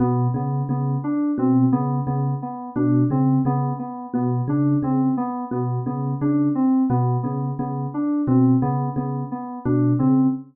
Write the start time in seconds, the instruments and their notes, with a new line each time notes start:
0.00 electric piano 1 B2, electric piano 2 B3
0.34 electric piano 1 C#3, electric piano 2 B3
0.69 electric piano 1 C#3, electric piano 2 B3
1.04 electric piano 2 D4
1.38 electric piano 1 B2, electric piano 2 C4
1.72 electric piano 1 C#3, electric piano 2 B3
2.07 electric piano 1 C#3, electric piano 2 B3
2.42 electric piano 2 B3
2.76 electric piano 1 B2, electric piano 2 D4
3.10 electric piano 1 C#3, electric piano 2 C4
3.45 electric piano 1 C#3, electric piano 2 B3
3.79 electric piano 2 B3
4.14 electric piano 1 B2, electric piano 2 B3
4.48 electric piano 1 C#3, electric piano 2 D4
4.83 electric piano 1 C#3, electric piano 2 C4
5.17 electric piano 2 B3
5.51 electric piano 1 B2, electric piano 2 B3
5.86 electric piano 1 C#3, electric piano 2 B3
6.21 electric piano 1 C#3, electric piano 2 D4
6.55 electric piano 2 C4
6.90 electric piano 1 B2, electric piano 2 B3
7.23 electric piano 1 C#3, electric piano 2 B3
7.59 electric piano 1 C#3, electric piano 2 B3
7.94 electric piano 2 D4
8.27 electric piano 1 B2, electric piano 2 C4
8.62 electric piano 1 C#3, electric piano 2 B3
8.96 electric piano 1 C#3, electric piano 2 B3
9.31 electric piano 2 B3
9.65 electric piano 1 B2, electric piano 2 D4
9.99 electric piano 1 C#3, electric piano 2 C4